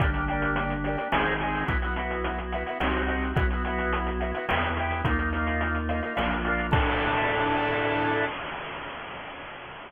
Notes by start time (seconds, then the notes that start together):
0.00 G1 A#3 D4 G4, kick, closed hi-hat
0.13 A#3 D4 G4, closed hi-hat
0.28 D4 G4, closed hi-hat
0.33 A#3
0.42 closed hi-hat
0.56 closed hi-hat
0.70 closed hi-hat
0.84 D4 G4, closed hi-hat
0.89 A#3
0.97 A#3 D4 G4, closed hi-hat
1.12 G#1 C4 D#4 G#4, snare
1.26 closed hi-hat
1.40 D#4 G#4, closed hi-hat
1.45 C4
1.54 open hi-hat
1.66 B1 B3 E4 F#4, kick, closed hi-hat
1.82 B3 E4 F#4, closed hi-hat
1.94 B3 E4 F#4, closed hi-hat
2.10 closed hi-hat
2.24 closed hi-hat
2.38 closed hi-hat
2.52 B3 E4 F#4, closed hi-hat
2.66 E4 F#4, closed hi-hat
2.70 B3
2.80 C2 C4 D#4 F#4, snare
2.94 closed hi-hat
3.06 C4 D#4 F#4, closed hi-hat
3.22 closed hi-hat
3.36 B1 B3 E4 F#4, kick, closed hi-hat
3.50 E4 F#4, closed hi-hat
3.55 B3
3.64 E4 F#4, closed hi-hat
3.69 B3
3.79 closed hi-hat
3.93 closed hi-hat
4.07 closed hi-hat
4.20 B3 E4 F#4, closed hi-hat
4.34 B3 E4 F#4, closed hi-hat
4.48 E2 B3 E4 G4, snare
4.63 closed hi-hat
4.77 E4 G4, closed hi-hat
4.82 B3
4.91 closed hi-hat
5.05 D#2 A#3 D#4 F4, kick, closed hi-hat
5.10 A#3
5.18 A#3 D#4 F4, closed hi-hat
5.33 A#3 D#4 F4, closed hi-hat
5.47 closed hi-hat
5.61 closed hi-hat
5.75 closed hi-hat
5.89 A#3 D#4 F4, closed hi-hat
6.02 A#3 D#4 F4, closed hi-hat
6.15 A#1 A#3 D4 F4, snare
6.31 closed hi-hat
6.44 A#3 D4 F4, closed hi-hat
6.59 closed hi-hat
6.71 A2 D4 E4 A4, kick, crash